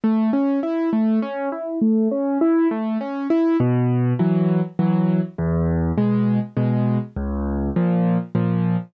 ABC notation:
X:1
M:3/4
L:1/8
Q:1/4=101
K:C#m
V:1 name="Acoustic Grand Piano"
A, C E A, C E | A, C E A, C E | [K:G#m] B,,2 [E,F,]2 [E,F,]2 | E,,2 [B,,G,]2 [B,,G,]2 |
C,,2 [A,,^E,]2 [A,,E,]2 |]